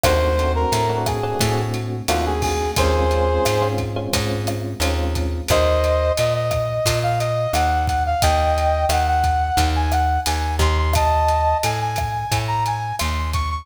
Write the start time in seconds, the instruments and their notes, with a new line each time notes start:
0.03 electric bass (finger) D#2, electric piano 1 A3 C4 D4 F#4, brass section C5, kick, cross-stick, closed hi-hat
0.38 electric piano 1 A3 C4 D4 F#4, closed hi-hat
0.55 brass section A#4
0.72 electric bass (finger) A2, closed hi-hat
0.89 electric piano 1 A3 C4 D4 F#4
1.06 brass section G#4, kick, cross-stick, closed hi-hat
1.23 electric piano 1 A3 C4 D4 F#4
1.39 electric bass (finger) A2, electric piano 1 A3 C4 D4 F#4, kick, closed hi-hat
1.74 closed hi-hat
2.08 electric bass (finger) D#2, electric piano 1 A3 C4 D4 F#4, brass section F4, cross-stick, closed hi-hat
2.26 brass section G#4
2.42 brass section G#4, kick, open hi-hat
2.76 electric bass (finger) D#2, electric piano 1 G#3 C4 C#4 F4, brass section G#4 C5, kick, closed hi-hat
3.11 electric piano 1 G#3 C4 C#4 F4, closed hi-hat
3.45 electric bass (finger) G#2, cross-stick, closed hi-hat
3.62 electric piano 1 G#3 C4 C#4 F4
3.78 kick, closed hi-hat
3.96 electric piano 1 G#3 C4 C#4 F4
4.13 electric bass (finger) G#2, electric piano 1 G#3 C4 C#4 F4, kick, closed hi-hat
4.47 cross-stick, closed hi-hat
4.80 electric bass (finger) D#2, electric piano 1 G#3 C4 C#4 F4, closed hi-hat
5.15 kick, closed hi-hat
5.48 electric bass (finger) D#2, brass section C5 D#5, kick, cross-stick, closed hi-hat
5.84 closed hi-hat
6.17 electric bass (finger) A#2, brass section D#5, closed hi-hat
6.34 brass section D#5
6.51 kick, cross-stick, closed hi-hat
6.86 electric bass (finger) A#2, kick, closed hi-hat
7.03 brass section F5
7.19 brass section D#5, closed hi-hat
7.53 electric bass (finger) D#2, brass section F#5, cross-stick, closed hi-hat
7.87 brass section F#5, kick, closed hi-hat
8.06 brass section F5
8.22 electric bass (finger) D#2, brass section D#5 G5, kick, closed hi-hat
8.58 closed hi-hat
8.89 electric bass (finger) D#2, brass section F#5, cross-stick, closed hi-hat
9.07 brass section F#5
9.24 kick, closed hi-hat
9.57 electric bass (finger) D#2, kick, closed hi-hat
9.76 brass section G#5
9.92 brass section F#5, cross-stick, closed hi-hat
10.26 electric bass (finger) D#2, brass section G#5, closed hi-hat
10.59 electric bass (finger) D#2, brass section C6, kick, closed hi-hat
10.78 brass section C6
10.93 brass section D#5 A5, kick, cross-stick, closed hi-hat
11.28 closed hi-hat
11.63 electric bass (finger) A2, brass section G#5, closed hi-hat
11.81 brass section G#5
11.96 kick, cross-stick, closed hi-hat
12.32 electric bass (finger) A2, kick, closed hi-hat
12.48 brass section A#5
12.66 brass section G#5, closed hi-hat
12.99 electric bass (finger) D#2, brass section C6, cross-stick, closed hi-hat
13.33 brass section C#6, kick, closed hi-hat
13.51 brass section C#6